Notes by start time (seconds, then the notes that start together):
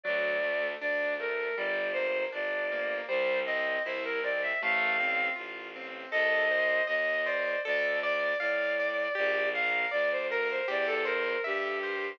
0.03 D2 F#3 D5
0.43 A3
0.80 D2 D4 D5
1.20 A3 A#4
1.57 G1 G3 D5
1.93 A#3 C5
2.32 G1 D4 D5
2.72 A#3
3.08 C2 G3 C5
3.46 C4 D#5
3.84 C2 E4 C5
4.05 A#4
4.23 C4 D5
4.42 E5
4.61 A1 A3 F5
5.00 C4
5.36 A1 F4
5.76 C4
6.11 C2 A4 D#5
6.51 C5
6.87 D#2 D#5
7.25 C5 D5
7.65 D2 A4 D5
8.02 D5
8.39 A2 D5 F5
8.80 D5
9.15 A#1 G4 D5
9.54 A#4 F5
9.91 D2 D5
10.12 C5
10.30 A#4
10.50 C5
10.68 E2 G4 D5
10.87 A4
11.05 A#4 C5
11.44 G2 G4 E5
11.83 C5